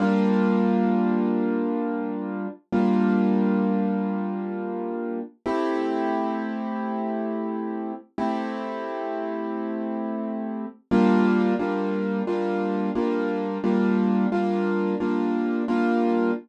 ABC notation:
X:1
M:4/4
L:1/8
Q:"Swing 16ths" 1/4=88
K:Gdor
V:1 name="Acoustic Grand Piano"
[G,B,DF]8 | [G,B,DF]8 | [A,CEG]8 | [A,CEG]8 |
[G,B,DF]2 [G,B,DF]2 [G,B,DF]2 [G,B,DF]2 | [G,B,DF]2 [G,B,DF]2 [G,B,DF]2 [G,B,DF]2 |]